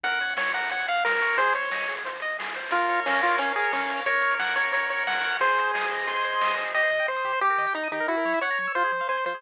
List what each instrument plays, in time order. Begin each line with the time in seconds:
0.03 synth bass 1 F#2, lead 1 (square) A#4 F#5, kick, closed hi-hat
0.12 closed hi-hat
0.20 lead 1 (square) C#5, closed hi-hat
0.29 closed hi-hat
0.37 lead 1 (square) C#5 F#5, snare
0.48 closed hi-hat
0.54 lead 1 (square) A#4 F#5, kick, closed hi-hat
0.63 closed hi-hat
0.69 lead 1 (square) C#5 F#5, kick, closed hi-hat
0.79 closed hi-hat
0.88 lead 1 (square) F5 F#5, closed hi-hat
0.96 closed hi-hat
1.04 lead 1 (square) A#4, snare
1.12 closed hi-hat
1.21 lead 1 (square) C#5, closed hi-hat
1.29 open hi-hat
1.37 synth bass 1 G#1, lead 1 (square) G#4 C5, kick, closed hi-hat
1.47 closed hi-hat
1.53 lead 1 (square) C5 C#5, closed hi-hat
1.62 closed hi-hat
1.71 lead 1 (square) D#5, snare
1.81 closed hi-hat
1.88 lead 1 (square) G#4, closed hi-hat
1.97 closed hi-hat
2.04 lead 1 (square) C5, kick, closed hi-hat
2.15 closed hi-hat
2.20 lead 1 (square) D#5, closed hi-hat
2.30 closed hi-hat
2.39 lead 1 (square) G#4, snare
2.46 closed hi-hat
2.54 lead 1 (square) C5, closed hi-hat
2.64 open hi-hat
2.71 synth bass 1 A#1, lead 1 (square) F4 A#4, kick, closed hi-hat
2.82 closed hi-hat
2.88 lead 1 (square) C#5, closed hi-hat
3.06 lead 1 (square) C#4 F5, snare, closed hi-hat
3.15 closed hi-hat
3.22 lead 1 (square) F4 C#5, kick, closed hi-hat
3.31 closed hi-hat
3.38 lead 1 (square) C#4 A#4, kick, closed hi-hat
3.48 closed hi-hat
3.56 lead 1 (square) G#4 C#5, closed hi-hat
3.63 closed hi-hat
3.73 lead 1 (square) C#4 F5, snare
3.79 closed hi-hat
3.89 lead 1 (square) C#5, closed hi-hat
3.98 closed hi-hat
4.06 synth bass 1 F#2, lead 1 (square) A#4 C#5, kick, closed hi-hat
4.14 closed hi-hat
4.21 lead 1 (square) C#5, closed hi-hat
4.31 closed hi-hat
4.39 lead 1 (square) F#5, snare
4.48 closed hi-hat
4.56 lead 1 (square) C#5, kick, closed hi-hat
4.64 closed hi-hat
4.73 lead 1 (square) A#4 C#5, kick, closed hi-hat
4.80 closed hi-hat
4.89 lead 1 (square) C#5, closed hi-hat
4.97 closed hi-hat
5.07 lead 1 (square) F#5, snare
5.17 closed hi-hat
5.23 lead 1 (square) C#5, closed hi-hat
5.31 closed hi-hat
5.40 synth bass 1 G#1, lead 1 (square) G#4 C5, kick, closed hi-hat
5.50 closed hi-hat
5.57 lead 1 (square) C5, closed hi-hat
5.67 closed hi-hat
5.74 lead 1 (square) D#5, snare
5.81 closed hi-hat
5.90 lead 1 (square) C5, kick, closed hi-hat
5.99 closed hi-hat
6.07 lead 1 (square) G#4 C6, kick, closed hi-hat
6.15 closed hi-hat
6.24 lead 1 (square) C5, closed hi-hat
6.33 closed hi-hat
6.41 synth bass 1 A#1, lead 1 (square) D#5, snare
6.47 closed hi-hat
6.58 synth bass 1 B1, lead 1 (square) C5, closed hi-hat
6.66 closed hi-hat
6.74 synth bass 1 C2, lead 1 (square) G4 D#5
6.83 lead 1 (square) C5
6.91 synth bass 1 C3, lead 1 (square) D#5
6.99 lead 1 (square) G5
7.08 synth bass 1 C2, lead 1 (square) C5 C6
7.16 lead 1 (square) D#6
7.25 synth bass 1 C3, lead 1 (square) G4
7.33 lead 1 (square) C5
7.41 synth bass 1 D#2, lead 1 (square) G4
7.50 lead 1 (square) A#4
7.58 synth bass 1 D#3, lead 1 (square) D#5
7.66 lead 1 (square) G5
7.74 synth bass 1 D#2, lead 1 (square) D#4 A#5
7.83 lead 1 (square) D#6
7.92 synth bass 1 D#3, lead 1 (square) D#4 G4
8.00 lead 1 (square) A#4
8.08 synth bass 1 F#2, lead 1 (square) E4 F#4
8.17 lead 1 (square) A#4
8.25 synth bass 1 F#3, lead 1 (square) C#5
8.34 lead 1 (square) E5
8.41 synth bass 1 F#2, lead 1 (square) C#5 F#5
8.50 lead 1 (square) A#5
8.59 synth bass 1 F#3, lead 1 (square) C#6
8.67 lead 1 (square) E6
8.75 synth bass 1 F2, lead 1 (square) F4 C5
8.84 lead 1 (square) G#4
8.92 synth bass 1 F3, lead 1 (square) C5
9.01 lead 1 (square) F5
9.09 synth bass 1 F2, lead 1 (square) C5 G#5
9.17 lead 1 (square) C6
9.26 synth bass 1 F3, lead 1 (square) F4 C5
9.34 lead 1 (square) G#4